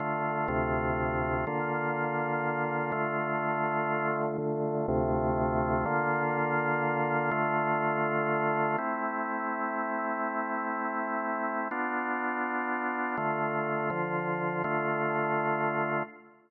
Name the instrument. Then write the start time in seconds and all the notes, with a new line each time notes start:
drawbar organ
0.00 D3 A3 F4
0.48 D2 C3 A3 F4
1.47 D3 A#3 F4
2.92 D3 A3 F4
4.38 D3 A3 F4
4.88 D2 C3 A3 F4
5.85 D3 A#3 F4
7.31 D3 A3 F4
8.78 A3 C4 E4
11.71 B3 D4 F4
13.17 D3 A3 F4
13.90 D3 F3 F4
14.64 D3 A3 F4